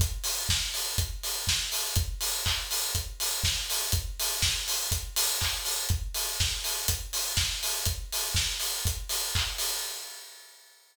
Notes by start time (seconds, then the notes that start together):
0.00 kick, closed hi-hat
0.24 open hi-hat
0.49 kick, snare
0.74 open hi-hat
0.98 kick, closed hi-hat
1.23 open hi-hat
1.47 kick, snare
1.72 open hi-hat
1.96 kick, closed hi-hat
2.21 open hi-hat
2.46 kick, clap
2.71 open hi-hat
2.95 kick, closed hi-hat
3.20 open hi-hat
3.44 kick, snare
3.70 open hi-hat
3.92 kick, closed hi-hat
4.20 open hi-hat
4.42 kick, snare
4.68 open hi-hat
4.92 kick, closed hi-hat
5.16 open hi-hat
5.41 kick, clap
5.65 open hi-hat
5.89 kick, closed hi-hat
6.14 open hi-hat
6.40 kick, snare
6.64 open hi-hat
6.88 kick, closed hi-hat
7.13 open hi-hat
7.37 kick, snare
7.63 open hi-hat
7.85 kick, closed hi-hat
8.12 open hi-hat
8.35 kick, snare
8.60 open hi-hat
8.85 kick, closed hi-hat
9.09 open hi-hat
9.35 kick, clap
9.58 open hi-hat